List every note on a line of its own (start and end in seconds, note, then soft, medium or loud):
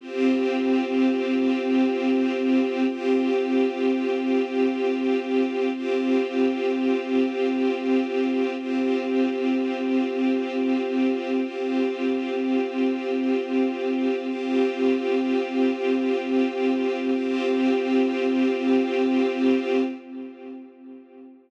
0.01 2.84 C4 loud
0.01 2.84 F4 medium
0.01 2.84 G4 medium
2.87 5.69 C4 medium
2.87 5.69 F4 medium
2.87 5.69 G4 medium
5.72 8.55 C4 medium
5.72 8.55 F4 medium
5.72 8.55 G4 medium
8.58 11.40 C4 medium
8.58 11.40 F4 medium
8.58 11.40 G4 medium
11.43 14.26 C4 medium
11.43 14.26 F4 medium
11.43 14.26 G4 medium
14.28 17.11 C4 medium
14.28 17.11 F4 medium
14.28 17.11 G4 medium
17.14 19.81 C4 loud
17.14 19.81 F4 medium
17.14 19.81 G4 medium